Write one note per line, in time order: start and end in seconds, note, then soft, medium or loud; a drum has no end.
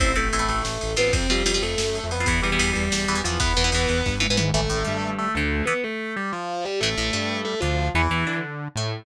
0.00 0.14 A1 medium
0.00 0.12 C4 medium
0.00 0.13 C4 medium
0.00 0.12 E4 medium
0.00 0.12 A4 medium
0.00 0.13 C5 loud
0.00 kick loud
0.00 ride loud
0.16 0.30 A1 medium
0.16 0.46 A3 medium
0.16 0.29 C4 medium
0.16 0.29 E4 medium
0.16 0.29 A4 medium
0.16 0.46 A4 medium
0.16 ride medium
0.33 0.47 A1 medium
0.33 0.39 C4 medium
0.33 0.39 E4 medium
0.33 0.39 A4 medium
0.33 ride medium
0.39 0.65 C4 medium
0.39 0.65 E4 medium
0.39 0.65 A4 medium
0.48 0.62 A1 medium
0.48 0.62 A3 medium
0.48 0.62 A4 medium
0.48 ride medium
0.63 0.78 A1 medium
0.63 0.90 A3 medium
0.63 0.90 A4 medium
0.63 snare medium
0.81 0.96 A1 medium
0.81 ride medium
0.96 1.12 A1 medium
0.96 1.13 B3 medium
0.96 1.26 C4 medium
0.96 1.26 F4 medium
0.96 1.13 B4 medium
0.96 ride medium
1.12 1.27 F2 medium
1.12 1.27 C4 medium
1.12 1.27 C5 loud
1.12 kick loud
1.12 ride loud
1.29 1.43 F2 medium
1.29 1.60 G3 medium
1.29 1.43 C4 medium
1.29 1.43 F4 medium
1.29 1.60 G4 medium
1.29 ride medium
1.45 1.59 F2 medium
1.45 1.52 C4 medium
1.45 1.52 F4 medium
1.45 ride loud
1.54 1.80 C4 medium
1.54 1.80 F4 medium
1.62 1.75 F2 medium
1.62 2.06 A3 medium
1.62 2.06 A4 medium
1.62 ride medium
1.78 2.00 F#2 medium
1.78 snare loud
1.95 ride medium
2.03 2.25 F2 medium
2.11 2.26 B3 medium
2.11 2.26 B4 medium
2.11 ride medium
2.20 2.27 C4 medium
2.20 2.27 F4 medium
2.26 2.41 E2 medium
2.26 2.41 E3 medium
2.26 2.41 B3 medium
2.26 2.41 B4 medium
2.26 kick loud
2.26 ride loud
2.42 2.58 E2 medium
2.42 2.50 E3 medium
2.42 2.69 G3 medium
2.42 2.50 B3 medium
2.42 2.69 G4 medium
2.42 ride medium
2.52 2.58 E3 medium
2.52 2.58 B3 medium
2.59 2.73 E2 medium
2.59 2.85 E3 medium
2.59 2.85 B3 medium
2.59 ride loud
2.73 2.89 E2 medium
2.73 2.89 G3 medium
2.73 2.89 G4 medium
2.73 ride medium
2.90 3.06 E2 medium
2.90 3.17 G3 medium
2.90 3.17 G4 medium
2.90 snare loud
3.08 3.22 E2 medium
3.08 3.15 E3 medium
3.08 3.15 B3 medium
3.08 ride medium
3.15 3.22 E3 medium
3.15 3.22 B3 medium
3.24 3.39 E2 medium
3.24 3.38 E3 medium
3.24 3.38 F3 medium
3.24 3.38 B3 medium
3.24 3.38 F4 medium
3.24 ride medium
3.40 3.54 E2 medium
3.40 3.53 E3 medium
3.40 3.53 B3 medium
3.40 4.10 B3 loud
3.40 4.10 B4 loud
3.40 kick loud
3.40 ride medium
3.57 3.71 E2 medium
3.57 3.63 E3 medium
3.57 3.63 B3 medium
3.57 ride medium
3.64 3.71 E3 medium
3.64 3.71 B3 medium
3.72 3.86 E2 medium
3.72 4.00 E3 medium
3.72 4.00 B3 medium
3.72 ride loud
3.89 4.03 E2 medium
3.89 ride medium
4.06 4.28 G2 medium
4.06 kick medium
4.06 snare medium
4.20 4.27 E3 medium
4.20 4.27 B3 medium
4.20 high tom medium
4.29 4.51 G#2 medium
4.29 4.37 E3 medium
4.29 4.37 B3 medium
4.37 4.50 E3 medium
4.37 4.50 B3 medium
4.37 mid tom loud
4.54 4.68 A1 medium
4.54 4.61 E3 medium
4.54 5.08 A3 loud
4.54 4.61 A3 medium
4.54 5.08 A4 loud
4.70 4.84 A1 medium
4.70 4.83 A2 medium
4.85 5.29 G2 medium
4.85 5.26 G3 medium
5.19 5.32 A3 medium
5.19 5.32 A4 medium
5.35 5.62 D2 medium
5.35 5.64 D3 medium
5.35 5.64 A3 medium
5.35 5.64 A4 medium
5.66 5.74 E3 medium
5.66 5.79 B3 medium
5.66 5.74 B3 medium
5.66 5.79 B4 loud
5.84 6.12 A3 medium
5.84 6.12 A4 medium
6.16 6.30 G3 medium
6.16 6.30 G4 medium
6.32 6.64 F3 medium
6.32 6.64 F4 medium
6.65 6.79 G3 medium
6.65 6.79 G4 medium
6.81 6.95 A1 medium
6.81 6.89 E3 medium
6.81 7.38 A3 medium
6.81 6.89 A3 medium
6.81 7.38 A4 loud
6.97 7.11 A1 medium
6.97 7.11 A2 medium
7.13 7.55 G2 medium
7.13 7.54 G3 medium
7.45 7.59 A3 medium
7.45 7.59 A4 medium
7.60 7.90 D2 medium
7.60 7.89 D3 medium
7.60 7.87 F3 medium
7.60 7.87 F4 medium
7.94 8.08 E2 medium
7.94 8.02 E3 medium
7.94 8.37 E3 medium
7.94 8.02 B3 medium
7.94 8.37 E4 medium
8.10 8.24 E2 medium
8.10 8.25 E3 medium
8.27 8.68 D3 medium
8.27 8.68 D4 medium
8.76 9.03 A2 medium
8.76 9.05 A3 medium